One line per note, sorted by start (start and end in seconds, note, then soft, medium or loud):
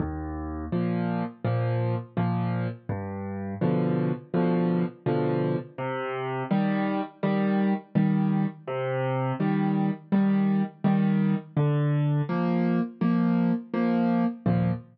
0.00 0.65 D#2 loud
0.72 1.23 A#2 medium
0.72 1.23 F3 medium
1.45 1.95 A#2 medium
1.45 1.95 F3 medium
2.17 2.67 A#2 medium
2.17 2.67 F3 medium
2.89 3.54 G2 loud
3.61 4.12 B2 loud
3.61 4.12 D3 medium
3.61 4.12 F3 medium
4.34 4.84 B2 loud
4.34 4.84 D3 medium
4.34 4.84 F3 medium
5.06 5.57 B2 medium
5.06 5.57 D3 medium
5.06 5.57 F3 loud
5.78 6.43 C3 loud
6.51 7.01 D#3 medium
6.51 7.01 G3 loud
7.23 7.73 D#3 medium
7.23 7.73 G3 loud
7.95 8.46 D#3 medium
7.95 8.46 G3 medium
8.67 9.33 C3 loud
9.40 9.90 D#3 medium
9.40 9.90 G3 medium
10.12 10.63 D#3 medium
10.12 10.63 G3 medium
10.84 11.35 D#3 loud
10.84 11.35 G3 medium
11.57 12.22 D3 loud
12.29 12.80 F3 medium
12.29 12.80 A#3 medium
13.01 13.52 F3 medium
13.01 13.52 A#3 medium
13.74 14.24 F3 loud
13.74 14.24 A#3 medium
14.46 14.71 D#2 loud
14.46 14.71 A#2 loud
14.46 14.71 F3 loud